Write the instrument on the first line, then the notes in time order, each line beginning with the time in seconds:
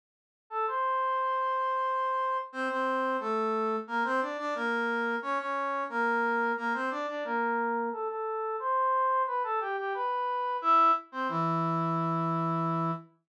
brass section
0.50 A4 A5
0.67 C5 C6
2.52 C4 C5
2.70 C4 C5
3.20 A3 A4
3.87 A#3 A#4
4.04 C4 C5
4.21 D4 D5
4.38 D4 D5
4.55 A#3 A#4
5.22 C#4 C#5
5.39 C#4 C#5
5.89 A#3 A#4
6.57 A#3 A#4
6.74 C4 C5
6.90 D4 D5
7.08 D4 D5
7.24 A#3 A#4
7.92 A4 A5
8.08 A4 A5
8.60 C5 C6
9.27 B4 B5
9.43 A4 A5
9.60 G4 G5
9.77 G4 G5
9.94 B4 B5
10.62 E4 E5
11.12 C4 C5
11.29 E3 E4